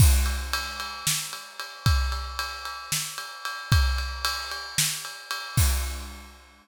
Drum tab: CC |x------|-------|-------|x------|
RD |-xxx-xx|xxxx-xx|xxxx-xx|-------|
SD |----o--|----o--|----o--|-------|
BD |o------|o------|o------|o------|